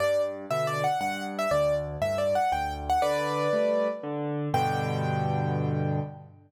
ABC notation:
X:1
M:3/4
L:1/16
Q:1/4=119
K:G
V:1 name="Acoustic Grand Piano"
d2 z2 (3e2 d2 f2 f2 z e | d2 z2 (3e2 d2 f2 g2 z f | [Bd]8 z4 | g12 |]
V:2 name="Acoustic Grand Piano"
G,,4 [B,,D,]4 G,,4 | D,,4 [G,,A,,]4 D,,4 | D,4 [G,A,]4 D,4 | [G,,B,,D,]12 |]